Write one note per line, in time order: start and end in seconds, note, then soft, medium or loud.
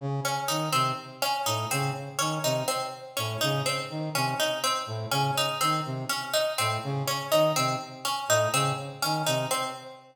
0.01 0.20 C#3 medium
0.25 0.44 C#4 medium
0.48 0.69 D#3 medium
0.48 0.68 D#4 medium
0.72 0.93 C3 medium
0.72 0.92 C4 medium
1.22 1.42 C#4 medium
1.46 1.66 A2 medium
1.46 1.66 D#4 medium
1.71 1.91 C#3 medium
1.71 1.91 C4 medium
2.19 2.39 D#3 medium
2.19 2.38 C#4 medium
2.44 2.63 C3 medium
2.44 2.64 D#4 medium
2.68 2.87 C4 medium
3.17 3.37 A2 medium
3.17 3.36 C#4 medium
3.41 3.62 C#3 medium
3.41 3.60 D#4 medium
3.66 3.85 C4 medium
3.90 4.09 D#3 medium
4.15 4.34 C3 medium
4.15 4.35 C#4 medium
4.40 4.59 D#4 medium
4.64 4.83 C4 medium
4.87 5.06 A2 medium
5.11 5.31 C#3 medium
5.11 5.31 C#4 medium
5.38 5.57 D#4 medium
5.61 5.81 D#3 medium
5.61 5.80 C4 medium
5.85 6.05 C3 medium
6.09 6.29 C#4 medium
6.34 6.53 D#4 medium
6.58 6.78 A2 medium
6.58 6.78 C4 medium
6.84 7.03 C#3 medium
7.08 7.27 C#4 medium
7.32 7.53 D#3 medium
7.32 7.51 D#4 medium
7.56 7.76 C3 medium
7.56 7.76 C4 medium
8.05 8.24 C#4 medium
8.28 8.48 A2 medium
8.28 8.49 D#4 medium
8.53 8.72 C#3 medium
8.53 8.73 C4 medium
9.02 9.23 D#3 medium
9.02 9.22 C#4 medium
9.27 9.46 C3 medium
9.27 9.46 D#4 medium
9.51 9.70 C4 medium